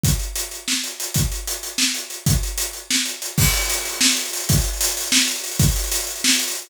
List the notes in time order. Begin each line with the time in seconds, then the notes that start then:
0.04 kick, closed hi-hat
0.19 closed hi-hat
0.36 closed hi-hat
0.51 closed hi-hat
0.68 snare
0.84 closed hi-hat
1.00 closed hi-hat
1.14 kick, closed hi-hat
1.32 closed hi-hat
1.47 closed hi-hat
1.63 closed hi-hat
1.78 snare
1.95 closed hi-hat
2.10 closed hi-hat
2.26 kick, closed hi-hat
2.43 closed hi-hat
2.58 closed hi-hat
2.73 closed hi-hat
2.91 snare
3.05 closed hi-hat
3.22 closed hi-hat
3.38 kick, crash
3.45 closed hi-hat
3.53 closed hi-hat
3.62 closed hi-hat
3.70 closed hi-hat
3.77 closed hi-hat
3.85 closed hi-hat
3.92 closed hi-hat
4.01 snare
4.09 closed hi-hat
4.17 closed hi-hat
4.25 closed hi-hat
4.33 closed hi-hat
4.40 closed hi-hat
4.49 kick, closed hi-hat
4.58 closed hi-hat
4.64 closed hi-hat
4.73 closed hi-hat
4.81 closed hi-hat
4.88 closed hi-hat
4.97 closed hi-hat
5.04 closed hi-hat
5.12 snare
5.20 closed hi-hat
5.28 closed hi-hat
5.36 closed hi-hat
5.44 closed hi-hat
5.51 closed hi-hat
5.59 kick, closed hi-hat
5.68 closed hi-hat
5.76 closed hi-hat
5.84 closed hi-hat
5.92 closed hi-hat
6.00 closed hi-hat
6.07 closed hi-hat
6.16 closed hi-hat
6.24 snare
6.31 closed hi-hat
6.39 closed hi-hat
6.48 closed hi-hat
6.55 closed hi-hat
6.62 closed hi-hat